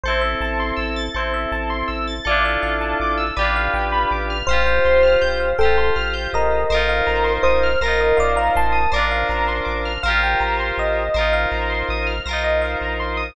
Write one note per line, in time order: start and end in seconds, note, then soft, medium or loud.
0.04 0.35 A1 medium
0.04 1.05 A4 medium
0.04 0.20 C5 medium
0.08 1.05 C4 medium
0.08 1.05 E4 medium
0.21 0.38 E5 medium
0.41 0.72 A1 medium
0.41 0.58 A5 medium
0.60 0.76 C6 medium
0.77 1.09 A1 medium
0.77 0.93 E6 medium
0.96 1.13 A6 medium
1.14 1.46 A1 medium
1.14 2.14 E4 medium
1.14 2.14 A4 medium
1.14 1.33 C5 medium
1.19 2.14 C4 medium
1.34 1.50 E5 medium
1.52 1.83 A1 medium
1.52 1.69 A5 medium
1.70 1.87 C6 medium
1.88 2.20 A1 medium
1.88 2.04 E6 medium
2.07 2.24 A6 medium
2.25 2.57 A1 medium
2.25 3.25 F4 loud
2.25 3.25 A4 medium
2.25 2.43 D5 medium
2.29 3.25 D4 loud
2.29 3.25 E4 medium
2.45 2.62 E5 medium
2.63 2.94 A1 medium
2.63 2.79 F5 medium
2.81 2.98 A5 medium
3.00 3.31 A1 medium
3.00 3.18 D6 medium
3.18 3.34 E6 medium
3.37 3.69 A1 medium
3.37 4.37 G4 loud
3.37 4.37 B4 medium
3.37 3.54 D5 medium
3.41 4.37 D4 medium
3.41 4.37 F4 medium
3.56 3.73 F5 medium
3.74 4.05 A1 medium
3.74 3.91 G5 medium
3.92 4.09 B5 medium
4.11 4.43 A1 medium
4.11 4.28 D6 medium
4.30 4.47 F6 medium
4.47 4.79 A1 medium
4.47 5.51 C5 medium
4.47 5.49 C5 medium
4.47 4.65 F5 medium
4.51 5.49 F4 medium
4.51 5.49 G4 loud
4.67 4.83 G5 medium
4.85 5.17 A1 medium
4.85 5.02 C6 medium
5.03 5.20 F6 medium
5.22 5.54 A1 medium
5.22 5.38 G6 medium
5.40 5.57 F5 medium
5.59 5.91 A1 medium
5.59 5.94 A4 medium
5.59 6.61 C5 medium
5.59 5.75 G5 medium
5.63 6.61 F4 medium
5.63 6.61 G4 medium
5.78 5.94 C6 medium
5.96 6.28 A1 medium
5.96 6.13 F6 medium
6.14 6.30 G6 medium
6.33 6.65 A1 medium
6.33 7.32 A#4 medium
6.33 6.88 D#5 medium
6.70 7.02 A1 medium
6.70 7.70 A#4 loud
6.70 7.70 C5 medium
6.74 7.70 D#4 medium
6.74 7.70 F4 medium
6.89 7.06 F5 medium
7.07 7.39 A1 medium
7.07 7.23 A#5 medium
7.24 7.41 C6 medium
7.43 7.76 A1 medium
7.43 7.78 C5 medium
7.43 7.60 D#6 medium
7.63 7.80 F6 medium
7.81 8.13 A1 medium
7.81 8.18 A#4 medium
7.81 8.81 A#4 medium
7.81 8.81 C5 medium
7.81 7.99 A#6 medium
7.85 8.81 D#4 medium
7.85 8.81 F4 medium
8.01 8.17 D#5 medium
8.17 8.50 A1 medium
8.17 8.38 D5 medium
8.17 8.34 F5 medium
8.36 8.54 F5 medium
8.36 8.53 A#5 medium
8.56 8.87 A1 medium
8.56 8.91 A5 medium
8.56 8.73 C6 medium
8.72 8.89 D#6 medium
8.92 9.24 A1 medium
8.92 9.92 A#4 loud
8.92 9.92 C5 medium
8.92 9.10 D5 medium
8.96 9.92 D4 medium
8.96 9.92 F4 medium
9.11 9.28 F5 medium
9.29 9.61 A1 medium
9.29 9.46 A#5 medium
9.48 9.65 C6 medium
9.65 9.98 A1 medium
9.65 9.81 D6 medium
9.85 10.02 F6 medium
10.03 10.35 A1 medium
10.03 11.03 A#4 medium
10.03 11.03 C5 loud
10.03 10.20 F5 medium
10.08 11.03 F4 loud
10.08 11.03 G4 medium
10.23 10.40 G5 medium
10.40 10.72 A1 medium
10.40 10.57 A#5 medium
10.60 10.77 C6 medium
10.78 11.09 A1 medium
10.78 11.33 D#5 medium
11.14 11.46 A1 medium
11.14 12.14 A#4 medium
11.14 12.14 C5 medium
11.18 12.14 D#4 medium
11.18 12.14 F4 medium
11.33 11.50 F5 medium
11.52 11.83 A1 medium
11.52 11.69 A#5 medium
11.70 11.86 C6 medium
11.89 12.20 A1 medium
11.89 12.07 D#6 medium
12.07 12.23 F6 medium
12.26 12.76 B1 medium
12.26 13.27 A#4 medium
12.26 13.27 C5 medium
12.26 12.42 A#6 medium
12.31 13.27 D#4 medium
12.31 13.27 F4 medium
12.44 12.61 D#5 medium
12.62 12.78 F5 medium
12.81 13.31 A#1 medium
12.81 12.99 A#5 medium
13.00 13.16 C6 medium
13.17 13.34 D#6 medium